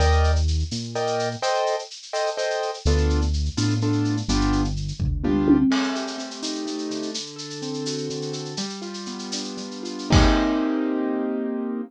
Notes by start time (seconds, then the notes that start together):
0.00 D#2 A#4 D5 D#5 G5, shaker
0.12 shaker
0.24 shaker
0.36 shaker
0.48 shaker
0.59 shaker
0.71 A#2, tambourine, shaker
0.83 shaker
0.95 A#4 D5 D#5 G5, shaker
1.07 shaker
1.19 shaker
1.31 shaker
1.42 A4 C5 D#5 G5, shaker
1.55 shaker
1.66 shaker
1.79 shaker
1.90 shaker
2.02 shaker
2.13 A4 C5 D#5 G5, tambourine, shaker
2.26 shaker
2.37 A4 C5 D#5 G5, shaker
2.50 shaker
2.62 shaker
2.74 shaker
2.85 D2 B3 D4 F4 A4, shaker
2.97 shaker
3.10 shaker
3.21 shaker
3.33 shaker
3.45 shaker
3.57 A2 B3 D4 F4 A4, tambourine, shaker
3.70 shaker
3.81 B3 D4 F4 A4, shaker
3.93 shaker
4.05 shaker
4.17 shaker
4.28 G1 B3 D4 F4 G4, shaker
4.41 shaker
4.52 shaker
4.64 shaker
4.76 shaker
4.88 shaker
5.00 D2, kick, floor tom
5.24 B3 D4 F4 G4, mid tom
5.48 high tom
5.70 A3, crash
5.84 shaker
5.95 G4, shaker
6.07 shaker
6.18 C4, shaker
6.31 shaker
6.42 D#4, tambourine, shaker
6.55 shaker
6.66 A3, shaker
6.78 shaker
6.90 D3, shaker
7.02 shaker
7.14 shaker
7.26 shaker
7.36 A4, shaker
7.50 shaker
7.62 C4, shaker
7.74 shaker
7.86 F#4, tambourine, shaker
7.98 shaker
8.10 D3, shaker
8.22 shaker
8.33 A4, shaker
8.45 shaker
8.57 G3, shaker
8.69 shaker
8.82 F4, shaker
8.94 shaker
9.06 B3, shaker
9.19 shaker
9.32 D4, tambourine, shaker
9.44 shaker
9.57 G3, shaker
9.71 shaker
9.83 F4, shaker
9.99 shaker
10.10 A#3 C4 D#4 G4, kick, crash